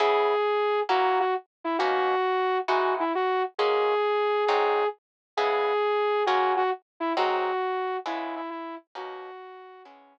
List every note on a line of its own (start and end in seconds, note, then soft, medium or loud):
0.00 0.35 C#3 loud
0.00 0.35 B3 medium
0.00 0.35 E4 loud
0.00 0.35 G#4 medium
0.00 0.80 G#4 medium
0.89 1.25 F#3 loud
0.89 1.25 A#3 medium
0.89 1.25 C#4 medium
0.89 1.25 E4 medium
0.89 1.18 F#4 medium
1.20 1.34 F#4 medium
1.64 1.77 E4 medium
1.79 2.15 B2 medium
1.79 2.15 A#3 medium
1.79 2.15 C#4 loud
1.79 2.15 D#4 medium
1.79 2.58 F#4 medium
2.68 3.04 E3 medium
2.68 3.04 G#3 medium
2.68 3.04 D#4 medium
2.68 2.93 F#4 medium
2.68 3.04 F#4 medium
3.00 3.12 E4 medium
3.15 3.42 F#4 medium
3.58 3.95 F#3 medium
3.58 3.95 G#3 medium
3.58 3.95 A#3 medium
3.58 3.95 C#4 medium
3.58 4.44 G#4 medium
4.46 4.84 G#2 loud
4.46 4.84 F#3 medium
4.46 4.84 C4 medium
4.46 4.84 D#4 medium
4.46 4.86 G#4 medium
5.37 5.73 C#3 medium
5.37 5.73 G#3 medium
5.37 5.73 B3 medium
5.37 5.73 E4 medium
5.37 6.23 G#4 medium
6.26 6.63 F#3 medium
6.26 6.63 G#3 medium
6.26 6.63 A#3 medium
6.26 6.63 C#4 medium
6.26 6.53 F#4 medium
6.57 6.70 F#4 medium
7.00 7.13 E4 medium
7.17 7.53 G#2 medium
7.17 7.53 F#3 medium
7.17 7.53 C4 loud
7.17 7.53 D#4 medium
7.17 7.97 F#4 medium
8.06 8.41 C#3 medium
8.06 8.41 G#3 medium
8.06 8.41 B3 loud
8.06 8.41 E4 medium
8.06 8.35 E4 medium
8.36 8.50 E4 medium
8.50 8.75 E4 medium
8.95 9.31 B2 medium
8.95 9.31 A#3 medium
8.95 9.31 C#4 medium
8.95 9.31 D#4 loud
8.95 9.82 F#4 medium
9.85 10.18 C#3 medium
9.85 10.18 G#3 medium
9.85 10.18 B3 medium
9.85 10.18 C#4 medium
9.85 10.18 E4 loud